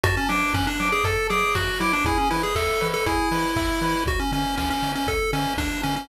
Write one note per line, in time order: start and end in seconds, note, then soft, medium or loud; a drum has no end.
0.04 0.18 F#2 loud
0.04 0.16 F#4 loud
0.04 0.26 A5 loud
0.04 kick medium
0.04 closed hi-hat loud
0.17 0.29 C#4 loud
0.29 0.44 F#3 loud
0.29 0.53 D4 medium
0.29 0.52 D6 medium
0.29 open hi-hat medium
0.54 0.68 F#2 loud
0.54 0.66 C#4 loud
0.54 0.77 F#6 medium
0.54 kick loud
0.54 snare loud
0.67 0.89 D4 loud
0.80 0.94 F#3 medium
0.80 1.03 D6 medium
0.80 open hi-hat medium
0.92 1.04 G#4 medium
1.04 1.18 F#2 loud
1.04 1.28 A4 medium
1.04 1.27 A5 medium
1.04 kick medium
1.04 closed hi-hat loud
1.30 1.44 F#3 medium
1.30 1.55 G#4 medium
1.30 1.52 D6 medium
1.30 open hi-hat medium
1.55 1.70 F#2 medium
1.55 1.80 F#4 loud
1.55 1.78 F#6 medium
1.55 kick medium
1.55 snare loud
1.80 1.94 F#3 loud
1.80 1.92 E4 loud
1.80 2.03 D6 medium
1.80 open hi-hat medium
1.93 2.05 D4 loud
2.05 2.18 E2 loud
2.05 2.18 E4 loud
2.05 2.28 G#4 loud
2.05 kick loud
2.05 closed hi-hat loud
2.18 2.30 C#4 medium
2.31 2.46 E3 medium
2.31 2.43 E4 medium
2.31 2.54 B4 medium
2.31 open hi-hat medium
2.43 2.55 G#4 medium
2.55 2.69 E2 loud
2.55 2.88 A4 medium
2.55 2.79 E5 medium
2.55 kick medium
2.55 clap loud
2.81 2.96 E3 medium
2.81 3.04 B4 medium
2.81 open hi-hat medium
2.94 3.06 A4 loud
3.06 3.20 E2 medium
3.06 4.04 E4 loud
3.06 3.29 G#4 medium
3.06 kick medium
3.06 closed hi-hat loud
3.32 3.45 E3 medium
3.32 3.54 B4 medium
3.32 open hi-hat medium
3.56 3.70 E2 medium
3.56 3.79 E5 medium
3.56 kick loud
3.56 clap loud
3.81 3.95 E3 medium
3.81 4.05 B4 medium
3.81 open hi-hat medium
4.06 4.20 D2 loud
4.06 4.20 F#4 loud
4.06 kick loud
4.06 closed hi-hat loud
4.20 4.32 C#4 medium
4.32 4.46 D3 loud
4.32 4.56 C#4 loud
4.32 open hi-hat medium
4.57 4.72 D2 medium
4.57 4.69 C#4 medium
4.57 kick medium
4.57 snare loud
4.70 4.92 C#4 loud
4.82 4.96 D3 medium
4.82 open hi-hat medium
4.95 5.07 C#4 medium
5.07 5.21 D2 medium
5.07 5.31 A4 loud
5.07 kick medium
5.07 closed hi-hat loud
5.33 5.47 D3 loud
5.33 5.54 C#4 loud
5.33 open hi-hat medium
5.57 5.71 D2 loud
5.57 5.82 D4 medium
5.57 kick medium
5.57 snare loud
5.83 5.98 D3 loud
5.83 5.95 C#4 loud
5.83 open hi-hat medium
5.96 6.08 C#4 loud